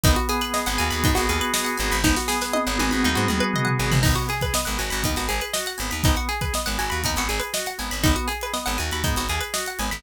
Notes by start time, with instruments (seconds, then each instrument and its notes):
0.04 electric bass (finger) G#1, drawbar organ B3, pizzicato strings D#4, kick, closed hi-hat
0.16 pizzicato strings F#4, closed hi-hat
0.29 drawbar organ G#4, pizzicato strings G#4, closed hi-hat
0.41 pizzicato strings B4, closed hi-hat
0.54 drawbar organ B3, pizzicato strings D#5, snare
0.66 electric bass (finger) G#1, pizzicato strings F#5, closed hi-hat
0.78 electric bass (finger) D#2, drawbar organ F#4, pizzicato strings G#5, closed hi-hat
0.91 electric bass (finger) D#2, pizzicato strings B5, closed hi-hat
1.04 electric bass (finger) G#2, drawbar organ B3, pizzicato strings D#4, kick, closed hi-hat
1.15 electric bass (finger) G#1, pizzicato strings F#4, snare, closed hi-hat
1.28 electric bass (finger) D#2, drawbar organ G#4, pizzicato strings G#4, closed hi-hat
1.41 pizzicato strings B4, closed hi-hat
1.54 drawbar organ F#4, pizzicato strings D#5, snare
1.65 pizzicato strings F#5, closed hi-hat
1.77 electric bass (finger) G#1, drawbar organ B3, pizzicato strings G#5, closed hi-hat
1.91 electric bass (finger) G#1, pizzicato strings B5, closed hi-hat
2.04 electric bass (finger) G#1, drawbar organ B3, pizzicato strings D#4, kick, snare
2.16 pizzicato strings F#4, snare
2.28 pizzicato strings G#4, drawbar organ G#4, snare
2.41 pizzicato strings B4, snare
2.53 drawbar organ B3, pizzicato strings D#5, high tom
2.67 electric bass (finger) G#1, pizzicato strings F#5
2.78 electric bass (finger) G#1, drawbar organ F#4, pizzicato strings G#5, high tom
2.91 electric bass (finger) G#1, pizzicato strings B5, high tom
3.03 electric bass (finger) D#2, drawbar organ B3, pizzicato strings D#4, mid tom
3.15 electric bass (finger) G#2, pizzicato strings F#4, mid tom
3.28 electric bass (finger) D#2, pizzicato strings G#4, drawbar organ G#4, mid tom
3.40 pizzicato strings B4
3.53 drawbar organ F#4, pizzicato strings D#5, floor tom
3.65 pizzicato strings F#5, floor tom
3.78 electric bass (finger) G#1, drawbar organ B3, pizzicato strings G#5
3.91 electric bass (finger) G#1, pizzicato strings B5, floor tom
4.03 electric bass (finger) G#1, drawbar organ B3, pizzicato strings D#4, kick, crash
4.15 pizzicato strings F#4, closed hi-hat
4.29 drawbar organ G#4, pizzicato strings G#4, closed hi-hat
4.41 pizzicato strings B4, kick, closed hi-hat
4.53 drawbar organ B3, pizzicato strings D#5, snare
4.65 electric bass (finger) G#1, pizzicato strings F#5, closed hi-hat
4.78 electric bass (finger) G#1, drawbar organ F#4, pizzicato strings G#5, snare, closed hi-hat
4.90 electric bass (finger) G#1, pizzicato strings B5, snare, closed hi-hat
5.03 electric bass (finger) D#2, drawbar organ B3, pizzicato strings D#4, kick, closed hi-hat
5.16 electric bass (finger) G#1, pizzicato strings F#4, snare, closed hi-hat
5.29 electric bass (finger) G#1, pizzicato strings G#4, drawbar organ G#4, closed hi-hat
5.41 pizzicato strings B4, closed hi-hat
5.53 drawbar organ F#4, pizzicato strings D#5, snare
5.66 pizzicato strings F#5, snare, closed hi-hat
5.78 electric bass (finger) G#1, drawbar organ B3, pizzicato strings G#5, snare, closed hi-hat
5.91 electric bass (finger) D#2, pizzicato strings B5, closed hi-hat
6.04 electric bass (finger) G#1, drawbar organ B3, pizzicato strings D#4, kick, closed hi-hat
6.16 pizzicato strings F#4, closed hi-hat
6.28 drawbar organ G#4, pizzicato strings G#4, closed hi-hat
6.41 pizzicato strings B4, kick, closed hi-hat
6.53 drawbar organ B3, pizzicato strings D#5, snare
6.66 electric bass (finger) G#1, pizzicato strings F#5, closed hi-hat
6.78 electric bass (finger) G#1, drawbar organ F#4, pizzicato strings G#5, closed hi-hat
6.90 electric bass (finger) D#2, pizzicato strings B5, closed hi-hat
7.04 electric bass (finger) D#2, drawbar organ B3, pizzicato strings D#4, kick, closed hi-hat
7.16 electric bass (finger) G#1, pizzicato strings F#4, snare, closed hi-hat
7.28 electric bass (finger) G#1, drawbar organ G#4, pizzicato strings G#4, snare, closed hi-hat
7.39 pizzicato strings B4, closed hi-hat
7.53 drawbar organ F#4, pizzicato strings D#5, snare
7.66 pizzicato strings F#5, snare, closed hi-hat
7.78 electric bass (finger) G#1, drawbar organ B3, pizzicato strings G#5, snare, closed hi-hat
7.91 electric bass (finger) G#1, pizzicato strings B5, closed hi-hat
8.04 electric bass (finger) G#1, drawbar organ B3, pizzicato strings D#4, kick, closed hi-hat
8.16 pizzicato strings F#4, closed hi-hat
8.28 pizzicato strings G#4, drawbar organ G#4, closed hi-hat
8.41 pizzicato strings B4, closed hi-hat
8.53 drawbar organ B3, pizzicato strings D#5, snare
8.66 electric bass (finger) G#1, pizzicato strings F#5, closed hi-hat
8.78 electric bass (finger) D#2, drawbar organ F#4, pizzicato strings G#5, closed hi-hat
8.91 electric bass (finger) D#2, pizzicato strings B5, closed hi-hat
9.04 electric bass (finger) G#2, drawbar organ B3, pizzicato strings D#4, kick, closed hi-hat
9.16 electric bass (finger) G#1, pizzicato strings F#4, snare, closed hi-hat
9.29 electric bass (finger) D#2, pizzicato strings G#4, drawbar organ G#4, closed hi-hat
9.41 pizzicato strings B4, closed hi-hat
9.54 drawbar organ F#4, pizzicato strings D#5, snare
9.66 pizzicato strings F#5, closed hi-hat
9.79 electric bass (finger) G#1, drawbar organ B3, pizzicato strings G#5, closed hi-hat
9.91 electric bass (finger) G#1, pizzicato strings B5, closed hi-hat